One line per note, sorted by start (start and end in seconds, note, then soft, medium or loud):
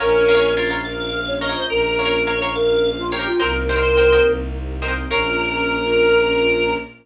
0.00 1.56 A#1 loud
0.00 3.37 A#3 medium
0.00 0.51 C#4 loud
0.00 3.37 C#4 medium
0.00 3.37 F4 medium
0.00 0.23 A#4 medium
0.00 0.69 A#4 medium
0.00 0.23 C#5 medium
0.00 0.23 F5 medium
0.28 0.34 A#4 medium
0.28 0.34 C#5 medium
0.28 0.34 F5 medium
0.35 0.52 A#4 medium
0.35 0.52 C#5 medium
0.35 0.52 F5 medium
0.57 0.81 F4 medium
0.57 0.68 A#4 medium
0.57 0.68 C#5 medium
0.57 0.68 F5 medium
0.70 0.93 A#4 medium
0.70 0.93 C#5 medium
0.70 0.93 F5 medium
0.85 1.19 A#4 medium
0.85 1.33 F5 medium
1.27 1.40 C#5 medium
1.41 1.47 A#4 medium
1.41 1.47 C#5 medium
1.41 1.54 C#5 medium
1.41 1.66 D#5 medium
1.41 1.47 F5 medium
1.49 1.72 A#4 medium
1.49 1.72 C#5 medium
1.49 1.72 F5 medium
1.55 1.67 C5 medium
1.70 3.27 A#1 loud
1.70 2.39 A#4 medium
1.70 2.22 A#4 loud
1.99 2.05 A#4 medium
1.99 2.05 C#5 medium
1.99 2.05 F5 medium
2.05 2.22 A#4 medium
2.05 2.22 C#5 medium
2.05 2.22 F5 medium
2.27 2.38 A#4 medium
2.27 2.51 C#5 medium
2.27 2.38 C#5 medium
2.27 2.38 F5 medium
2.42 2.65 A#4 medium
2.42 2.65 C#5 medium
2.42 2.65 F5 medium
2.54 2.90 A#4 medium
2.54 3.02 F5 medium
2.98 3.10 F4 medium
3.12 3.26 G4 medium
3.12 3.18 A#4 medium
3.12 3.18 C#5 medium
3.12 3.18 F5 medium
3.12 3.35 G5 medium
3.19 3.36 A#4 medium
3.19 3.36 C#5 medium
3.19 3.36 F5 medium
3.26 3.39 F4 medium
3.39 4.19 C2 loud
3.39 5.08 A#3 medium
3.39 5.08 C4 medium
3.39 5.08 D#4 medium
3.39 5.08 G4 medium
3.39 4.31 A#4 medium
3.39 3.62 A#4 medium
3.39 3.52 A#4 loud
3.39 3.62 C5 medium
3.39 3.62 D#5 medium
3.39 3.62 G5 medium
3.69 3.75 A#4 medium
3.69 3.75 C5 medium
3.69 3.75 D#5 medium
3.69 3.75 G5 medium
3.76 3.93 A#4 medium
3.76 3.93 C5 medium
3.76 3.93 D#5 medium
3.76 3.93 G5 medium
3.83 4.21 C5 medium
3.97 4.09 A#4 medium
3.97 4.09 C5 medium
3.97 4.09 D#5 medium
3.97 4.09 G5 medium
4.12 4.35 A#4 medium
4.12 4.35 C5 medium
4.12 4.35 D#5 medium
4.12 4.35 G5 medium
4.26 5.04 C2 loud
4.82 4.88 A#4 medium
4.82 4.88 C5 medium
4.82 4.88 D#5 medium
4.82 4.88 G5 medium
4.88 5.05 A#4 medium
4.88 5.05 C5 medium
4.88 5.05 D#5 medium
4.88 5.05 G5 medium
5.10 6.75 A#1 loud
5.10 6.75 A#3 loud
5.10 6.75 C#4 loud
5.10 6.75 F4 loud
5.10 6.75 A#4 loud
5.10 6.75 C#5 loud
5.10 6.75 F5 loud